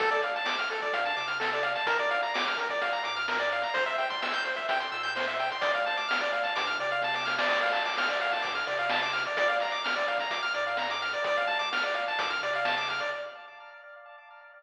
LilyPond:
<<
  \new Staff \with { instrumentName = "Lead 1 (square)" } { \time 4/4 \key d \minor \tempo 4 = 128 a'16 d''16 f''16 a''16 d'''16 f'''16 a'16 d''16 f''16 a''16 d'''16 f'''16 a'16 d''16 f''16 a''16 | bes'16 d''16 f''16 bes''16 d'''16 f'''16 bes'16 d''16 f''16 bes''16 d'''16 f'''16 bes'16 d''16 f''16 bes''16 | c''16 e''16 g''16 c'''16 e'''16 g'''16 c''16 e''16 g''16 c'''16 e'''16 g'''16 c''16 e''16 g''16 c'''16 | d''16 f''16 a''16 d'''16 f'''16 d''16 f''16 a''16 d'''16 f'''16 d''16 f''16 a''16 d'''16 f'''16 d''16 |
d''16 f''16 a''16 d'''16 f'''16 d''16 f''16 a''16 d'''16 f'''16 d''16 f''16 a''16 d'''16 f'''16 d''16 | d''16 f''16 bes''16 d'''16 f'''16 d''16 f''16 bes''16 d'''16 f'''16 d''16 f''16 bes''16 d'''16 f'''16 d''16 | d''16 f''16 a''16 d'''16 f'''16 d''16 f''16 a''16 d'''16 f'''16 d''16 f''16 a''16 d'''16 f'''16 d''16 | }
  \new Staff \with { instrumentName = "Synth Bass 1" } { \clef bass \time 4/4 \key d \minor d,4. d,8 g,8 c4. | bes,,4. bes,,8 ees,8 aes,4. | c,4. c,8 f,8 bes,4. | d,4. d,8 g,8 c4. |
d,4. d,8 g,8 c4. | bes,,4. bes,,8 ees,8 aes,4. | d,4. d,8 g,8 c4. | }
  \new DrumStaff \with { instrumentName = "Drums" } \drummode { \time 4/4 <hh bd>16 hh16 hh16 hh16 sn16 <hh bd>16 hh16 <hh bd>16 <hh bd>16 hh16 hh16 hh16 sn16 hh16 hh16 hh16 | <hh bd>16 hh16 hh16 hh16 sn16 <hh bd>16 <hh bd>16 <hh bd>16 <hh bd>16 hh16 hh16 hh16 sn16 hh16 hh16 hh16 | <hh bd>16 hh16 hh16 <hh bd>16 sn16 hh16 hh16 <hh bd>16 <hh bd>16 hh16 hh16 hh16 sn16 hh16 hh16 hh16 | <hh bd>16 hh16 hh16 hh16 sn16 <hh bd>16 hh16 <hh bd>16 <hh bd>16 hh16 <hh bd>16 hh16 <bd sn>16 sn16 sn16 sn16 |
<cymc bd>16 hh16 hh16 hh16 sn16 <hh bd>16 hh16 <hh bd>16 <hh bd>16 hh16 hh16 hh16 sn16 hh16 hh16 hh16 | <hh bd>16 hh16 hh16 hh16 sn16 <hh bd>16 <hh bd>16 <hh bd>16 <hh bd>16 hh16 hh16 hh16 sn16 hh16 hh16 hh16 | <hh bd>16 hh16 hh16 <hh bd>16 sn16 hh16 hh16 <hh bd>16 <hh bd>16 hh16 hh16 hh16 sn16 hh16 hh16 hh16 | }
>>